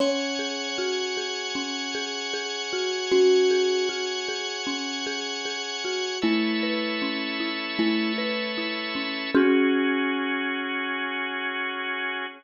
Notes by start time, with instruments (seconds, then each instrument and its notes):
0.00 marimba C#4, kalimba C#5, drawbar organ C#5 F#5 G#5
0.39 marimba G#4
0.78 marimba F#4
1.17 marimba G#4
1.55 marimba C#4
1.95 marimba G#4
2.34 marimba G#4
2.73 marimba F#4
3.12 marimba C#4, kalimba F#4
3.51 marimba G#4
3.89 marimba F#4
4.29 marimba G#4
4.67 marimba C#4
5.06 marimba G#4
5.45 marimba G#4
5.85 marimba F#4
6.22 marimba A3, kalimba E4, drawbar organ A4 B4 C#5 E5
6.63 marimba B4
7.02 marimba C#4
7.40 marimba E4
7.79 marimba A3, kalimba E4
8.18 marimba B4
8.58 marimba E4
8.95 marimba C#4
9.35 kalimba C#4, marimba C#4 F#4 G#4, drawbar organ C#4 F#4 G#4